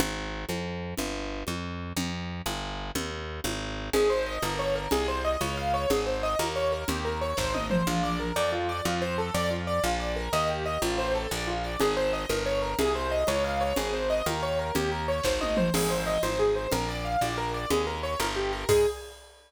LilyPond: <<
  \new Staff \with { instrumentName = "Acoustic Grand Piano" } { \time 6/8 \key aes \major \tempo 4. = 122 r2. | r2. | r2. | r2. |
aes'8 c''8 ees''8 bes'8 des''8 bes'8 | aes'8 c''8 ees''8 des''8 f''8 des''8 | aes'8 c''8 ees''8 bes'8 des''8 bes'8 | g'8 bes'8 des''8 c''8 ees''8 c''8 |
\key bes \major f'8 d''8 bes'8 d''8 f'8 d''8 | f'8 c''8 a'8 d''8 f'8 d''8 | f'8 d''8 bes'8 ees''8 g'8 ees''8 | f'8 c''8 a'8 d''8 f'8 d''8 |
\key aes \major aes'8 c''8 ees''8 bes'8 des''8 bes'8 | aes'8 c''8 ees''8 des''8 f''8 des''8 | aes'8 c''8 ees''8 bes'8 des''8 bes'8 | g'8 bes'8 des''8 c''8 ees''8 c''8 |
aes'8 c''8 ees''8 c''8 aes'8 c''8 | bes'8 d''8 f''8 d''8 bes'8 d''8 | aes'8 bes'8 des''8 bes'8 g'8 bes'8 | aes'4. r4. | }
  \new Staff \with { instrumentName = "Electric Bass (finger)" } { \clef bass \time 6/8 \key aes \major aes,,4. f,4. | g,,4. f,4. | f,4. g,,4. | ees,4. aes,,4. |
aes,,4. g,,4. | c,4. des,4. | aes,,4. ees,4. | ees,4. aes,,4. |
\key bes \major bes,,4. f,4. | f,4. f,4. | bes,,4. ees,4. | a,,4. bes,,4. |
\key aes \major aes,,4. g,,4. | c,4. des,4. | aes,,4. ees,4. | ees,4. aes,,4. |
aes,,4. aes,,4. | bes,,4. bes,,4. | ees,4. g,,4. | aes,4. r4. | }
  \new DrumStaff \with { instrumentName = "Drums" } \drummode { \time 6/8 cgl4. cgho4. | cgl4. cgho4. | cgl4. cgho4. | cgl4. cgho4. |
cgl4. cgho4. | cgl4. cgho4. | cgl4. cgho4. | cgl4. <bd sn>8 tommh8 toml8 |
r4. r4. | r4. r4. | r4. r4. | r4. r4. |
cgl4. cgho4. | cgl4. cgho4. | cgl4. cgho4. | cgl4. <bd sn>8 tommh8 toml8 |
<cgl cymc>4. cgho4. | cgl4. cgho4. | cgl4. cgho4. | <cymc bd>4. r4. | }
>>